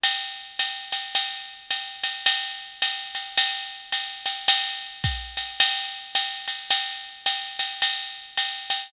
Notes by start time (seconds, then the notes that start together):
0.04 ride
0.59 hi-hat pedal, ride
0.92 ride
1.15 ride
1.71 hi-hat pedal, ride
2.04 ride
2.26 ride
2.82 hi-hat pedal, ride
3.15 ride
3.38 ride
3.92 hi-hat pedal, ride
4.26 ride
4.48 ride
5.04 kick, hi-hat pedal, ride
5.37 ride
5.60 ride
6.15 hi-hat pedal, ride
6.48 ride
6.71 ride
7.26 hi-hat pedal, ride
7.59 ride
7.82 ride
8.38 hi-hat pedal, ride
8.70 ride